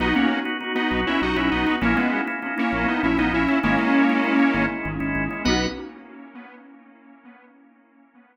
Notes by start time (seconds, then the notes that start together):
0.00 B1 B3 D#4 F#4
0.15 A#3 B3 C#4 D#4 F#4
0.45 B3 D#4 F#4
0.60 B3 D#4 F#4
0.75 B3 D#4 F#4
0.91 B1
1.07 C#4 E4
1.21 B1 B3 D#4 F#4
1.36 B1 B3 C#4 D#4 E4 F#4
1.51 B1 B3 D#4
1.67 B3 D#4 F#4
1.81 A#1 A#3 C#4 E4
1.96 G#3 A#3 B3 C#4 E4
2.27 A#3 C#4 E4
2.42 A#3 C#4 E4
2.58 A#3 C#4 E4
2.72 A#1
2.88 B3 D#4
3.03 A#1 A#3 C#4 E4
3.18 A#1 A#3 B3 C#4 D#4 E4
3.33 A#1 C#4 E4
3.48 A#3 C#4 E4
3.63 G#1 G#3 A#3 C#4 E4
3.79 G#3 C#4 E4
4.09 G#3 C#4 E4
4.24 G#3 C#4 E4
4.40 G#3 C#4 E4
4.54 G#1
4.85 G#1 G#3 C#4 E4
5.00 G#1 G#3 C#4 E4
5.15 G#1
5.30 G#3 C#4 E4
5.45 B1 B3 D#4 B4 D#5 F#5
5.49 F#4